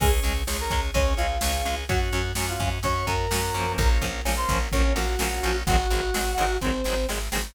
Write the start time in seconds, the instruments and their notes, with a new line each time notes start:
0.00 electric bass (finger) C#2, acoustic guitar (steel) G#3 C#4, drawbar organ C#4 G#4, brass section G#4 G#5, kick, crash
0.23 electric bass (finger) C#2, acoustic guitar (steel) G#3 C#4, ride
0.47 electric bass (finger) C#2, acoustic guitar (steel) G#3 C#4, drawbar organ C#4 G#4, snare
0.60 brass section A#4 A#5
0.70 electric bass (finger) C#2, acoustic guitar (steel) G#3 C#4, kick, ride
0.94 electric bass (finger) C#2, acoustic guitar (steel) G#3 C#4, brass section C#4 C#5, drawbar organ C#4 G#4, kick, ride
1.17 electric bass (finger) C#2, acoustic guitar (steel) G#3 C#4, brass section F4 F5, ride
1.41 electric bass (finger) C#2, acoustic guitar (steel) G#3 C#4, drawbar organ C#4 G#4, snare
1.65 electric bass (finger) C#2, acoustic guitar (steel) G#3 C#4, ride
1.89 electric bass (finger) F#2, acoustic guitar (steel) F#3 C#4, drawbar organ C#4 F#4, brass section F#4 F#5, kick, ride
2.13 electric bass (finger) F#2, acoustic guitar (steel) F#3 C#4, ride
2.35 electric bass (finger) F#2, acoustic guitar (steel) F#3 C#4, drawbar organ C#4 F#4, snare
2.49 brass section F4 F5
2.60 electric bass (finger) F#2, acoustic guitar (steel) F#3 C#4, kick, ride
2.83 electric bass (finger) F#2, acoustic guitar (steel) F#3 C#4, drawbar organ C#4 F#4, brass section C#5 C#6, kick, ride
3.07 electric bass (finger) F#2, acoustic guitar (steel) F#3 C#4, brass section A#4 A#5, kick, ride
3.31 electric bass (finger) F#2, acoustic guitar (steel) F#3 C#4, drawbar organ C#4 F#4, snare
3.54 electric bass (finger) F#2, acoustic guitar (steel) F3 A#3 C#4, ride
3.77 electric bass (finger) A#1, drawbar organ A#3 C#4 F4, brass section A#4 A#5, kick, ride
4.01 electric bass (finger) A#1, acoustic guitar (steel) F3 A#3 C#4, kick, ride
4.25 electric bass (finger) A#1, acoustic guitar (steel) F3 A#3 C#4, drawbar organ A#3 C#4 F4, snare
4.37 brass section C5 C6
4.49 electric bass (finger) A#1, acoustic guitar (steel) F3 A#3 C#4, kick, ride
4.72 electric bass (finger) A#1, acoustic guitar (steel) F3 A#3 C#4, drawbar organ A#3 C#4 F4, brass section C#4 C#5, kick
4.96 electric bass (finger) A#1, acoustic guitar (steel) F3 A#3 C#4, brass section F#4 F#5, ride
5.19 electric bass (finger) A#1, acoustic guitar (steel) F3 A#3 C#4, drawbar organ A#3 C#4 F4, snare
5.43 electric bass (finger) A#1, acoustic guitar (steel) F3 A#3 C#4, ride
5.66 electric bass (finger) G#1, acoustic guitar (steel) F#3 G#3 C4, brass section F#4 F#5, kick, ride
5.70 acoustic guitar (steel) D#3
5.90 electric bass (finger) G#1, acoustic guitar (steel) F#3 G#3 C4, ride
5.94 acoustic guitar (steel) D#3
6.14 electric bass (finger) G#1, acoustic guitar (steel) D#3 F#3 G#3 C4, snare
6.37 electric bass (finger) G#1, acoustic guitar (steel) D#3 F#3 G#3 C4, ride
6.61 electric bass (finger) G#1, acoustic guitar (steel) F#3 G#3 C4, brass section C4 C5, kick
6.65 acoustic guitar (steel) D#3
6.84 electric bass (finger) G#1, acoustic guitar (steel) F#3 G#3 C4, snare
6.89 acoustic guitar (steel) D#3
7.09 electric bass (finger) G#1, acoustic guitar (steel) D#3 F#3 G#3 C4, snare
7.32 electric bass (finger) G#1, acoustic guitar (steel) D#3 F#3 G#3 C4, snare